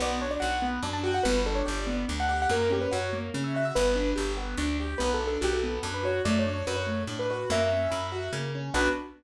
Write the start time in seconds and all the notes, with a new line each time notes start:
0.00 B1 B3 D5
0.21 D4 C#5
0.31 D5
0.40 B1 F#4 F#5
0.62 B3
0.83 F#2 D4
0.93 A5
1.03 F#4 G5
1.14 F#5
1.23 G1 B3 B4
1.46 D4 A4
1.55 C#5
1.66 G1 G4 D5
1.87 B3
2.08 D2 D4
2.20 F#5
2.29 G4 F#5
2.42 F#5
2.49 F#2 A#3 A#4
2.70 C#4 G4
2.81 B4
2.91 F#2 F#4 C#5
3.13 A#3
3.34 C#3 C#4
3.44 E5
3.54 F#4 E5
3.65 E5
3.75 G1 B3 B4
3.95 D4
4.16 G1 G4
4.37 B3
4.57 D2 D4
4.80 G4
4.98 B1 B3 B4
5.14 A4
5.20 D4
5.27 A4
5.41 B1 F#4 G4
5.53 A4
5.63 B3
5.83 F#2 D4
5.94 B4
6.03 F#4 C#5
6.25 F#2 A3 D5
6.39 C#5
6.46 D4
6.53 C#5
6.67 F#2 F#4 B4
6.76 C#5
6.86 A3
7.07 A2 D4
7.19 B4
7.30 F#4 B4
7.50 F#2 A#3 E5
7.72 C#4
7.91 F#2 E4
8.12 F#4
8.33 C#3 A#3
8.55 C#4
8.74 B1 B3 D4 F#4 B4